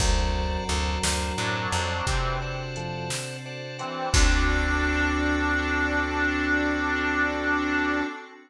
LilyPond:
<<
  \new Staff \with { instrumentName = "Harmonica" } { \time 12/8 \key d \major \tempo 4. = 58 r2 <fis d'>4 <e c'>8 r2 <e c'>8 | d'1. | }
  \new Staff \with { instrumentName = "Drawbar Organ" } { \time 12/8 \key d \major <fis, fis>2. r4 <f, f>8 r4. | d'1. | }
  \new Staff \with { instrumentName = "Drawbar Organ" } { \time 12/8 \key d \major <c'' d'' fis'' a''>4 <c'' d'' fis'' a''>8 <c'' d'' fis'' a''>8 <c'' d'' fis'' a''>8 <c'' d'' fis'' a''>4 <c'' d'' fis'' a''>4. <c'' d'' fis'' a''>8 <c'' d'' fis'' a''>8 | <c' d' fis' a'>1. | }
  \new Staff \with { instrumentName = "Electric Bass (finger)" } { \clef bass \time 12/8 \key d \major d,4 d,8 d,8 a,8 f,8 c2. | d,1. | }
  \new Staff \with { instrumentName = "Pad 5 (bowed)" } { \time 12/8 \key d \major <c' d' fis' a'>1. | <c' d' fis' a'>1. | }
  \new DrumStaff \with { instrumentName = "Drums" } \drummode { \time 12/8 <cymc bd>4 hh8 sn4 hh8 <hh bd>4 hh8 sn4 hh8 | <cymc bd>4. r4. r4. r4. | }
>>